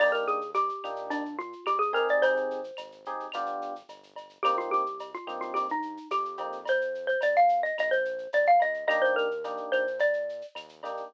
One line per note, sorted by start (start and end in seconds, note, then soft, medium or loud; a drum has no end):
0.00 0.71 D#2 loud
0.00 0.38 A#3 medium
0.00 0.38 D4 loud
0.00 0.38 D#4 loud
0.00 0.38 G4 loud
0.00 0.12 D5 loud
0.00 crash medium
0.00 cowbell medium
0.00 claves medium
0.12 0.25 A#4 medium
0.12 shaker medium
0.27 0.50 G#4 medium
0.27 shaker medium
0.41 shaker medium
0.54 1.06 G4 loud
0.54 cowbell medium
0.54 shaker medium
0.69 shaker medium
0.83 1.54 A#2 medium
0.83 1.23 A#3 medium
0.83 1.23 D4 medium
0.83 1.23 D#4 medium
0.83 1.23 G4 medium
0.83 claves medium
0.83 shaker medium
0.96 shaker medium
1.10 1.36 D4 loud
1.10 cowbell medium
1.10 shaker medium
1.25 shaker medium
1.39 1.64 F4 loud
1.39 shaker medium
1.53 shaker medium
1.66 2.14 G#2 medium
1.66 1.80 G4 loud
1.66 cowbell medium
1.66 claves medium
1.66 shaker medium
1.79 1.92 G#4 loud
1.79 shaker medium
1.93 2.60 C4 loud
1.93 2.60 D#4 loud
1.93 2.60 G4 medium
1.93 2.60 G#4 loud
1.93 2.08 A#4 loud
1.93 cowbell medium
1.93 shaker medium
2.09 2.23 D5 medium
2.09 shaker medium
2.22 2.72 G#1 loud
2.22 3.71 C5 loud
2.22 cowbell medium
2.22 shaker medium
2.37 shaker medium
2.51 shaker medium
2.64 shaker medium
2.77 3.28 G#1 medium
2.77 cowbell medium
2.77 claves medium
2.77 shaker medium
2.92 shaker medium
3.05 3.26 C4 medium
3.05 3.26 D#4 medium
3.05 3.26 G4 medium
3.05 3.26 G#4 medium
3.05 shaker medium
3.20 shaker medium
3.32 3.83 G1 medium
3.32 3.73 B3 loud
3.32 3.73 D4 medium
3.32 3.73 F4 loud
3.32 3.73 G4 loud
3.32 cowbell medium
3.32 claves medium
3.32 shaker medium
3.46 shaker medium
3.62 shaker medium
3.76 shaker medium
3.89 4.39 G1 medium
3.89 cowbell medium
3.89 shaker medium
4.03 shaker medium
4.16 cowbell medium
4.16 shaker medium
4.29 shaker medium
4.43 5.15 C2 medium
4.43 4.83 A#3 loud
4.43 4.83 C4 loud
4.43 4.83 D#4 loud
4.43 4.56 G4 loud
4.43 4.83 G4 medium
4.43 cowbell medium
4.43 claves medium
4.43 shaker loud
4.58 4.71 F4 loud
4.58 shaker medium
4.71 5.11 G4 loud
4.71 shaker medium
4.86 shaker medium
4.99 cowbell medium
4.99 shaker medium
5.14 5.40 F4 medium
5.14 shaker medium
5.27 5.99 G2 medium
5.27 5.66 A#3 medium
5.27 5.66 C4 medium
5.27 5.66 D#4 medium
5.27 5.66 G4 medium
5.27 claves medium
5.27 shaker medium
5.41 5.54 F4 medium
5.41 shaker medium
5.54 5.67 G4 medium
5.54 cowbell medium
5.54 shaker medium
5.69 6.08 D#4 loud
5.69 shaker medium
5.82 shaker medium
5.97 shaker medium
6.11 6.37 F2 medium
6.11 6.61 G4 medium
6.11 cowbell medium
6.11 claves medium
6.11 shaker medium
6.25 shaker medium
6.37 7.17 F2 medium
6.37 6.57 A#3 medium
6.37 6.57 C4 medium
6.37 6.57 D#4 medium
6.37 6.57 G4 medium
6.37 cowbell medium
6.37 shaker medium
6.52 shaker medium
6.66 7.07 C5 loud
6.66 cowbell medium
6.66 shaker medium
6.81 shaker medium
6.95 shaker medium
7.07 7.20 C5 medium
7.07 shaker medium
7.21 7.72 F2 medium
7.21 7.36 D5 medium
7.21 cowbell medium
7.21 claves medium
7.21 shaker loud
7.36 7.61 F5 loud
7.36 shaker medium
7.49 shaker medium
7.63 7.76 D#5 medium
7.63 shaker medium
7.78 8.28 A#1 loud
7.78 7.93 D#5 loud
7.78 cowbell medium
7.78 claves medium
7.78 shaker medium
7.91 8.28 C5 loud
7.91 shaker medium
8.05 shaker medium
8.18 shaker medium
8.33 8.58 C#2 medium
8.33 8.47 D5 loud
8.33 cowbell medium
8.33 shaker medium
8.46 8.61 F5 loud
8.46 shaker medium
8.60 8.86 D2 medium
8.60 8.85 D#5 loud
8.60 cowbell medium
8.60 shaker medium
8.74 shaker medium
8.88 9.60 D#2 loud
8.88 9.27 A#3 loud
8.88 9.27 D4 loud
8.88 9.27 D#4 medium
8.88 9.27 G4 loud
8.88 9.01 D#5 loud
8.88 cowbell medium
8.88 claves medium
8.88 shaker medium
9.02 9.15 C5 loud
9.02 shaker medium
9.16 9.65 A#4 loud
9.16 shaker medium
9.31 shaker medium
9.44 9.84 A#3 medium
9.44 9.84 D4 medium
9.44 9.84 D#4 medium
9.44 9.84 G4 medium
9.44 cowbell medium
9.44 shaker medium
9.57 shaker medium
9.72 10.43 A#2 medium
9.72 9.99 C5 loud
9.72 claves medium
9.72 shaker medium
9.87 shaker medium
9.99 10.46 D5 medium
9.99 cowbell medium
9.99 shaker medium
10.13 shaker medium
10.29 shaker medium
10.41 shaker medium
10.55 11.03 D#2 medium
10.55 cowbell medium
10.55 claves medium
10.55 shaker medium
10.69 shaker medium
10.83 11.03 A#3 medium
10.83 11.03 D4 medium
10.83 11.03 D#4 medium
10.83 11.03 G4 medium
10.83 cowbell medium
10.83 shaker medium
10.97 shaker medium